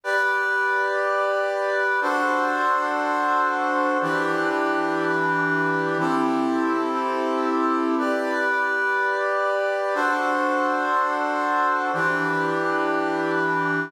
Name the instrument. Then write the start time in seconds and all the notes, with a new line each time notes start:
brass section
0.04 G4 B4 D5
2.01 D4 F#4 A4 C5
4.01 E3 D4 G4 B4
5.99 C4 E4 G4 A4
7.98 G4 B4 D5
9.94 D4 F#4 A4 C5
11.93 E3 D4 G4 B4